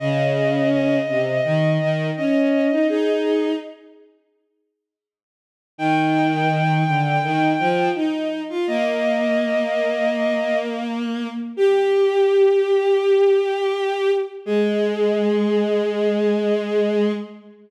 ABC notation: X:1
M:4/4
L:1/16
Q:1/4=83
K:Ablyd
V:1 name="Violin"
e4 e8 e4 | A4 z12 | g12 z4 | e12 z4 |
G12 z4 | A16 |]
V:2 name="Violin"
_D,6 C,2 E,2 E,2 _D3 E | E4 z12 | E,6 D,2 E,2 F,2 E3 F | B,16 |
G16 | A,16 |]